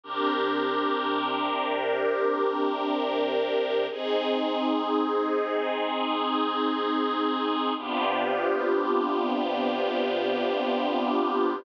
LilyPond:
\new Staff { \time 4/4 \key c \minor \tempo 4 = 62 <c d' g' bes'>1 | <c' ees' aes'>1 | <c b d' f' g'>1 | }